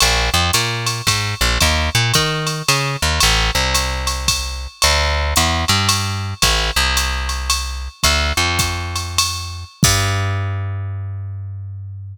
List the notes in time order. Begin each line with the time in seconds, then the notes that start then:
0.00 A#1, ride
0.34 F2
0.53 A#2, hi-hat pedal, ride
0.86 ride
1.07 G#2, kick, ride
1.41 A#1
1.60 D#2, kick, ride
1.95 A#2
2.14 D#3, kick, hi-hat pedal, ride
2.47 ride
2.68 C#3, ride
3.02 D#2
3.20 A1, ride
3.55 C2
3.74 hi-hat pedal, ride
4.07 ride
4.28 kick, ride
4.82 D2, ride
5.36 E2, hi-hat pedal, ride
5.68 G2, ride
5.89 ride
6.42 A1, kick, ride
6.76 C2
6.97 hi-hat pedal, ride
7.29 ride
7.50 ride
8.03 D2, kick, ride
8.37 F2
8.59 kick, hi-hat pedal, ride
8.96 ride
9.18 ride
9.83 G2, kick, crash